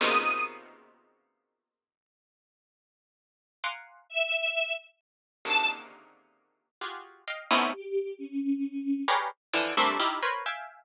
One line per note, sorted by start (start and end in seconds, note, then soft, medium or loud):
0.00 3.28 A#2 loud
0.00 3.28 B2 loud
0.00 3.28 C3 loud
0.00 3.28 C#3 loud
0.00 3.28 D#3 loud
0.00 0.41 D#6 medium
3.64 4.05 F5 medium
3.64 4.05 F#5 medium
3.64 4.05 G#5 medium
3.64 4.05 A#5 medium
3.64 4.05 C6 medium
3.64 4.05 D6 medium
4.10 4.71 E5 medium
5.45 6.68 A#2 medium
5.45 6.68 C3 medium
5.45 6.68 C#3 medium
5.45 6.68 D3 medium
5.45 6.68 D#3 medium
5.45 5.66 A5 loud
6.81 7.22 F4 medium
6.81 7.22 F#4 medium
6.81 7.22 G4 medium
6.81 7.22 G#4 medium
7.28 7.48 D#5 medium
7.28 7.48 F5 medium
7.28 7.48 G5 medium
7.51 7.71 A3 loud
7.51 7.71 B3 loud
7.51 7.71 C4 loud
7.51 7.71 C#4 loud
7.51 7.71 D#4 loud
7.51 7.71 E4 loud
7.73 8.14 G4 medium
8.18 9.00 C#4 medium
9.08 9.28 G4 medium
9.08 9.28 G#4 medium
9.08 9.28 A#4 medium
9.08 9.28 B4 medium
9.08 9.28 C#5 medium
9.08 9.28 D5 medium
9.53 9.74 D3 loud
9.53 9.74 E3 loud
9.53 9.74 F3 loud
9.77 9.98 G3 loud
9.77 9.98 A3 loud
9.77 9.98 A#3 loud
9.77 9.98 C4 loud
9.77 9.98 D4 loud
9.77 9.98 E4 loud
9.99 10.20 D#4 loud
9.99 10.20 E4 loud
9.99 10.20 F4 loud
9.99 10.20 G4 loud
10.23 10.43 A#4 loud
10.23 10.43 B4 loud
10.23 10.43 C5 loud
10.23 10.43 C#5 loud
10.46 10.84 E5 medium
10.46 10.84 F5 medium
10.46 10.84 G5 medium
10.46 10.84 G#5 medium